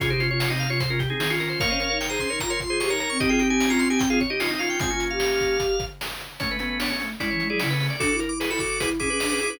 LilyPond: <<
  \new Staff \with { instrumentName = "Drawbar Organ" } { \time 4/4 \key f \minor \tempo 4 = 150 aes'16 c''8 des''8 ees''16 f''16 des''16 c''16 bes'16 g'16 aes'8. bes'16 c''16 | <des'' f''>4 g''16 bes''16 c'''8 bes''16 c'''16 c'''16 c'''16 des'''16 bes''16 bes''16 des'''16 | ees''16 g''8 aes''8 bes''16 c'''16 aes''16 g''16 f''16 des''16 ees''8. f''16 g''16 | aes''8. f''2~ f''16 r4 |
\key fis \minor cis''16 b'16 b'8 cis''8 r8 d''16 cis''8 d''16 d''16 b'8 d''16 | d'''16 d'''16 r16 d'''16 r16 b''16 d'''8. r16 d'''4. | }
  \new Staff \with { instrumentName = "Drawbar Organ" } { \time 4/4 \key f \minor <des' f'>16 <ees' g'>16 <des' f'>16 <des' f'>8 <c' ees'>8 <des' f'>16 r16 <des' f'>16 r16 <c' ees'>16 <c' ees'>16 <des' f'>16 <des' f'>8 | <bes' des''>16 <c'' ees''>16 <bes' des''>16 <bes' des''>8 <aes' c''>8 <bes' des''>16 r16 <bes' des''>16 r16 <aes' c''>16 <aes' c''>16 <bes' des''>16 <bes' des''>8 | <ees' g'>16 <f' aes'>16 <ees' g'>16 <ees' g'>8 <des' f'>8 <ees' g'>16 r16 <f' aes'>16 r16 <ees' g'>16 <des' f'>16 <c' ees'>16 <des' f'>8 | <aes c'>16 <bes des'>4.~ <bes des'>16 r2 |
\key fis \minor <a cis'>8 <a cis'>16 <a cis'>16 <b d'>16 <a cis'>16 <a cis'>16 r16 <cis' e'>8. <e' gis'>16 <cis' e'>16 <a cis'>16 <a cis'>8 | <fis' a'>8 ais'16 r16 <gis' b'>16 <fis' a'>16 <fis' a'>8 <gis' b'>16 r16 <e' gis'>16 <gis' b'>8 <gis' b'>16 <e' gis'>16 <gis' b'>16 | }
  \new Staff \with { instrumentName = "Ocarina" } { \time 4/4 \key f \minor c2. ees4 | bes16 des'16 des'16 ees'8. des'16 ees'16 f'16 r16 f'8 g'16 ees'8 c'16 | c'2. ees'4 | f'16 f'8 g'4.~ g'16 r4. |
\key fis \minor a16 a16 b4 a8 gis16 e16 gis16 fis16 cis8. r16 | d'16 e'16 e'16 e'8 e'16 fis'8 e'8 cis'16 cis'16 d'16 cis'16 e'16 d'16 | }
  \new DrumStaff \with { instrumentName = "Drums" } \drummode { \time 4/4 <hh bd>8 hh8 sn8 hh8 <hh bd>8 <hh bd>8 sn8 hh8 | <hh bd>8 hh8 sn8 <hh bd>8 <hh bd>8 <hh bd>8 sn8 hh8 | <hh bd>8 hh8 sn8 hh8 <hh bd>8 <hh bd>8 sn8 hh8 | <hh bd>8 hh8 sn8 <hh bd>8 <hh bd>8 <hh bd>8 sn8 hh8 |
<hh bd>8 hh8 sn8 hh8 <hh bd>8 hh8 sn8 hho8 | <hh bd>8 hh8 sn8 <hh bd>8 <hh bd>8 <hh bd>8 sn8 hh8 | }
>>